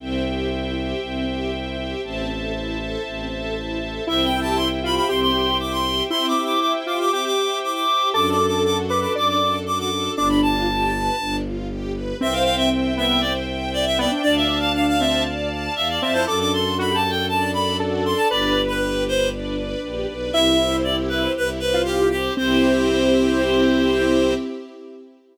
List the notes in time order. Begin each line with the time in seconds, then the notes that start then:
0.00 C2 C4 C5 E5 G5
0.25 G4
0.51 E4
0.77 G4
1.01 C2 C4
1.28 G4
1.53 E4
1.78 G4
2.03 A1 C4 C5 E5 A5
2.29 A4
2.54 E4
2.79 A4
3.04 A1 C4
3.31 A4
3.56 E4
3.80 A4
4.06 C2 C4 E4 C5 E5 G5
4.24 G5
4.33 G4
4.41 A5
4.56 E4 C6
4.83 F4 G4 B5
4.96 B5
5.08 C2 C4 G4 C6
5.21 C6
5.34 G4
5.58 E4 D6
5.72 C6
5.84 G4
6.10 C4 E4 C5 E5 G5 C6
6.28 D6
6.35 G4
6.45 D6
6.60 E4 D6
6.86 F4 G4 D6
6.99 D6
7.12 C4 G4 D6
7.26 D6
7.36 G4
7.63 E4 D6
7.74 D6
7.89 G4
8.13 F#2 D4 F#4 A4 D6
8.30 D6
8.40 A4
8.47 D6
8.63 F#4 D6
8.88 A4 B4 D6
9.01 D6
9.15 F#2 D4 D5 D6
9.28 D6
9.40 A4
9.66 F#4 D6
9.79 D6
9.91 A4
10.16 G1 D4 D6
10.29 B5
10.42 F4 A5
10.68 G4
10.93 B4
11.19 G1 D4
11.44 F4
11.69 G4
11.94 B4
12.20 C2 C4 C5 E5 G5
12.33 F5
12.44 F5 G5
12.57 E5
12.71 E5
12.97 B3 E5 G5
13.21 C5 D5
13.47 G5
13.73 D5 E5
13.86 E5
13.98 B3 D5 G5
14.11 D4
14.22 D2 D4 D5 F5 A5
14.36 E5
14.49 A5
14.60 F5
14.74 F5
14.88 F5
14.99 C4 E5 A5
15.25 D5
15.50 A5
15.76 E2 E5 F5
15.89 D5
16.01 F2 C4 E5 A5
16.13 E4 C5
16.26 F#2 D4 F#4 A4 D6
16.40 D6
16.52 A4 C6
16.78 F#4 B5
16.90 G4
16.94 A5
17.04 A4
17.10 G5
17.28 D4 A4 D5 A5
17.53 A4 B5
17.79 F#4 A4
18.05 A4 C6
18.16 A5
18.30 G1 D4 G4 B4 D5
18.56 B4
18.68 B4
18.82 G4
19.06 B4 C5
19.32 D4 B4 D5
19.58 B4
19.83 A#1 G4
20.08 B1 B4
20.33 C2 C4 E4 G4 E5
20.59 C5
20.84 G4 D5
21.09 B4 C5
21.36 C2 E4 B4
21.60 B4 C5
21.74 F4
21.85 G4
22.11 G4 C5
22.37 C2 C4 E4 G4 C5